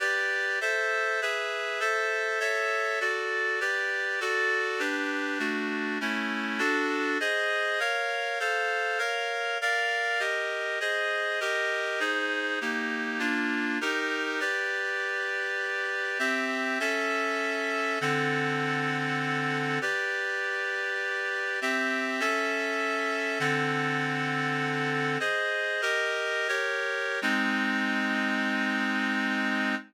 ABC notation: X:1
M:3/4
L:1/8
Q:1/4=100
K:G
V:1 name="Clarinet"
[GBd]2 [Ace]2 [^GBe]2 | [Ace]2 [A^ce]2 [FAd]2 | [GBd]2 [FAd]2 [DGB]2 | [A,DF]2 [A,^CE]2 [DFA]2 |
[K:Ab] [Ace]2 [Bdf]2 [=Acf]2 | [Bdf]2 [B=df]2 [GBe]2 | [Ace]2 [GBe]2 [EAc]2 | [B,EG]2 [B,=DF]2 [EGB]2 |
[K:G] [GBd]6 | [CGe]2 [^CAe]4 | [D,CAf]6 | [GBd]6 |
[CGe]2 [^CAe]4 | [D,CAf]6 | [K:Ab] "^rit." [Ace]2 [GBe]2 [GBd]2 | [A,CE]6 |]